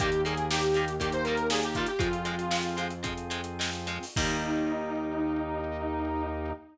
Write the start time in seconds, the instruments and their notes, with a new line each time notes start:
0.00 synth bass 1 D#2, overdriven guitar D#3 G3 A#3, drawbar organ A#3 D#4 G4, lead 1 (square) G4, kick, closed hi-hat
0.12 closed hi-hat
0.25 overdriven guitar D#3 G3 A#3, lead 1 (square) G#4, closed hi-hat
0.37 closed hi-hat
0.50 overdriven guitar D#3 G3 A#3, lead 1 (square) G4, snare
0.63 closed hi-hat
0.74 overdriven guitar D#3 G3 A#3, closed hi-hat
0.88 closed hi-hat
1.00 overdriven guitar D#3 G3 A#3, drawbar organ A#3 D#4 G4, lead 1 (square) G4, kick, closed hi-hat
1.12 lead 1 (square) C5, closed hi-hat
1.24 overdriven guitar D#3 G3 A#3, lead 1 (square) A#4, closed hi-hat
1.37 closed hi-hat
1.50 overdriven guitar D#3 G3 A#3, lead 1 (square) G#4, snare
1.63 lead 1 (square) G4, closed hi-hat
1.75 overdriven guitar D#3 G3 A#3, lead 1 (square) F4, kick, closed hi-hat
1.86 lead 1 (square) G4, closed hi-hat
1.99 synth bass 1 F2, overdriven guitar F3 G#3 C4, drawbar organ C4 F4 G#4, lead 1 (square) F4, kick, closed hi-hat
2.13 closed hi-hat
2.25 overdriven guitar F3 G#3 C4, closed hi-hat
2.39 closed hi-hat
2.51 overdriven guitar F3 G#3 C4, snare
2.63 closed hi-hat
2.77 overdriven guitar F3 G#3 C4, closed hi-hat
2.90 closed hi-hat
3.03 overdriven guitar F3 G#3 C4, drawbar organ C4 F4 G#4, kick, closed hi-hat
3.17 closed hi-hat
3.30 overdriven guitar F3 G#3 C4, closed hi-hat
3.44 closed hi-hat
3.59 overdriven guitar F3 G#3 C4, snare
3.73 closed hi-hat
3.87 overdriven guitar F3 G#3 C4, closed hi-hat
4.03 open hi-hat
4.16 synth bass 1 D#2, overdriven guitar D#3 G3 A#3, drawbar organ A#3 D#4 G4, lead 1 (square) D#4, kick, crash